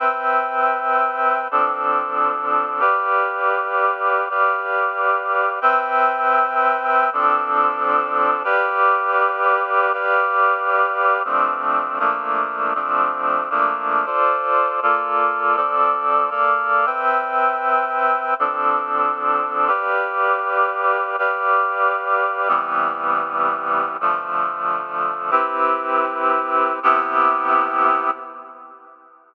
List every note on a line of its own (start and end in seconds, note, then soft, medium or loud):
0.00 1.48 C4 medium
0.00 1.48 B4 medium
0.00 1.48 E5 medium
0.00 1.48 G5 medium
1.51 2.81 F3 medium
1.51 2.81 C4 medium
1.51 2.81 D4 medium
1.51 2.81 A4 medium
2.80 4.28 G4 medium
2.80 4.28 B4 medium
2.80 4.28 D5 medium
2.80 4.28 F5 medium
4.29 5.59 G4 medium
4.29 5.59 B4 medium
4.29 5.59 D5 medium
4.29 5.59 F5 medium
5.61 7.10 C4 medium
5.61 7.10 B4 medium
5.61 7.10 E5 medium
5.61 7.10 G5 medium
7.13 8.43 F3 medium
7.13 8.43 C4 medium
7.13 8.43 D4 medium
7.13 8.43 A4 medium
8.44 9.92 G4 loud
8.44 9.92 B4 medium
8.44 9.92 D5 medium
8.44 9.92 F5 medium
9.93 11.23 G4 medium
9.93 11.23 B4 medium
9.93 11.23 D5 medium
9.93 11.23 F5 medium
11.25 11.99 F3 medium
11.25 11.99 A3 medium
11.25 11.99 C4 medium
11.25 11.99 D4 medium
11.99 12.74 F3 medium
11.99 12.74 A3 medium
11.99 12.74 A#3 medium
11.99 12.74 D4 medium
12.75 13.49 F3 medium
12.75 13.49 A3 medium
12.75 13.49 C4 medium
12.75 13.49 D4 medium
13.50 14.06 F3 medium
13.50 14.06 A3 medium
13.50 14.06 A#3 medium
13.50 14.06 D4 medium
14.06 14.80 F4 medium
14.06 14.80 A4 medium
14.06 14.80 C5 medium
14.06 14.80 D5 medium
14.82 15.56 A#3 medium
14.82 15.56 F4 medium
14.82 15.56 A4 medium
14.82 15.56 D5 medium
15.56 16.31 F3 medium
15.56 16.31 C4 medium
15.56 16.30 A4 medium
15.56 16.30 D5 medium
16.30 16.86 A#3 medium
16.30 16.86 A4 medium
16.30 16.86 D5 medium
16.30 16.86 F5 medium
16.86 18.34 C4 medium
16.86 18.34 B4 medium
16.86 18.34 E5 medium
16.86 18.34 G5 medium
18.39 19.69 F3 medium
18.39 19.69 C4 medium
18.39 19.69 D4 medium
18.39 19.69 A4 medium
19.68 21.16 G4 medium
19.68 21.16 B4 medium
19.68 21.16 D5 medium
19.68 21.16 F5 medium
21.19 22.48 G4 medium
21.19 22.48 B4 medium
21.19 22.48 D5 medium
21.19 22.48 F5 medium
22.48 23.97 C3 medium
22.48 23.97 E3 medium
22.48 23.97 G3 medium
22.48 23.97 B3 medium
24.01 25.31 D3 medium
24.01 25.31 F3 medium
24.01 25.31 A3 medium
25.31 26.79 C4 medium
25.31 26.79 E4 medium
25.31 26.79 G4 medium
25.31 26.79 B4 medium
26.83 28.10 C3 loud
26.83 28.10 B3 loud
26.83 28.10 E4 loud
26.83 28.10 G4 loud